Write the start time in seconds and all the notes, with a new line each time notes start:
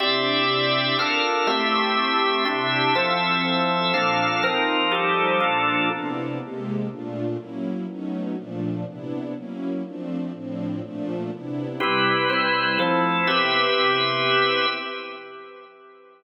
0.00 C3 C4 D4 E4 G4 D5 E5
0.98 D4 F4 A4 A#4 F5
1.47 A3 C4 E4 G4 E5
2.45 C3 C4 D4 E4 G4 E5
2.95 F3 C4 E4 A4 E5
3.93 A#2 F3 A#3 D4 A4 F5
4.43 F3 C4 D#4 A#4
4.91 F3 G3 D#4 G4 A4
5.40 A#2 F3 A#3 D4 F4 A4
5.90 C3 B3 D4 E4
6.39 C3 G#3 A#3 G4
6.89 A#2 A3 D4 F4
7.38 F#3 A#3 C#4 E4
7.87 F#3 A3 B3 C#4 D#4
8.36 A#2 F3 A3 D4
8.85 C3 B3 D4 E4
9.34 F#3 A#3 C#4 E4
9.84 F3 A3 C4 D4
10.33 A2 F3 C4 D4
10.82 A#2 F3 A3 D4
11.31 C3 B3 D4 E4
11.80 C3 G3 C4 E4 G4 B4
12.30 C4 E4 B4 C5
12.79 F3 A3 C4 E4 A4 C5
13.27 C3 B3 C4 E4 G4 B4 E5